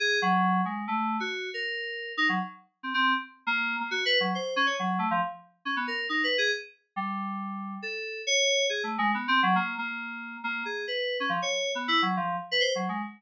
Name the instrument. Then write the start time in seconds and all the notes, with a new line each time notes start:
electric piano 2
0.00 G#4
0.22 F#3
0.65 G#3
0.88 A3
1.20 F#4
1.54 A#4
2.17 D#4
2.29 F#3
2.83 C4
2.94 C4
3.47 A#3
3.80 A#3
3.91 F#4
4.05 B4
4.20 F#3
4.35 C5
4.56 C#4
4.66 C#5
4.79 F#3
4.99 A3
5.11 F3
5.65 C#4
5.76 B3
5.87 A#4
6.09 D#4
6.24 B4
6.38 G#4
6.96 G3
7.82 A4
8.27 C#5
8.70 G#4
8.83 A3
8.98 G#3
9.14 B3
9.28 C4
9.43 F#3
9.55 A#3
9.78 A#3
10.44 A#3
10.65 G#4
10.88 B4
11.20 C#4
11.29 F3
11.42 C#5
11.75 B3
11.88 E4
12.02 F#3
12.17 F3
12.51 B4
12.60 C5
12.75 F#3
12.89 G#3